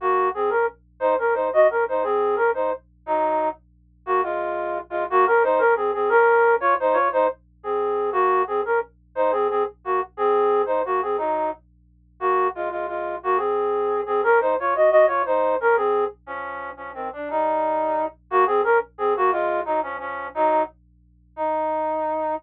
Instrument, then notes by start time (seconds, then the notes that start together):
flute
0.00 A#3 F#4
0.34 C4 G#4
0.50 C#4 A#4
1.00 D#4 C5
1.18 C#4 A#4
1.34 D#4 C5
1.53 F#4 D#5
1.70 C#4 A#4
1.88 D#4 C5
2.03 C4 G#4
2.36 C#4 A#4
2.54 D#4 C5
3.06 F#3 D#4
4.06 A#3 F#4
4.23 G#3 F4
4.90 G#3 F4
5.10 A#3 F#4
5.26 C#4 A#4
5.43 D#4 C5
5.59 C#4 A#4
5.76 C4 G#4
5.94 C4 G#4
6.09 C#4 A#4
6.60 F4 C#5
6.80 D#4 C5
6.93 F4 C#5
7.12 D#4 C5
7.63 C4 G#4
8.12 A#3 F#4
8.47 C4 G#4
8.65 C#4 A#4
9.15 D#4 C5
9.32 C4 G#4
9.50 C4 G#4
9.84 A#3 F#4
10.17 C4 G#4
10.66 D#4 C5
10.85 A#3 F#4
11.02 C4 G#4
11.18 F#3 D#4
12.20 A#3 F#4
12.55 G#3 F4
12.71 G#3 F4
12.88 G#3 F4
13.23 A#3 F#4
13.37 C4 G#4
14.06 C4 G#4
14.23 C#4 A#4
14.41 D#4 C5
14.60 F4 C#5
14.75 F#4 D#5
14.91 F#4 D#5
15.07 F4 C#5
15.26 D#4 C5
15.60 C#4 A#4
15.76 C4 G#4
16.26 F3 C#4
16.77 F3 C#4
16.94 D#3 C4
17.13 D4
17.30 G3 D#4
18.30 A#3 F#4
18.46 C4 G#4
18.64 C#4 A#4
18.98 C4 G#4
19.16 A#3 F#4
19.32 G#3 F4
19.65 F#3 D#4
19.83 F3 C#4
19.99 F3 C#4
20.34 F#3 D#4
21.36 D#4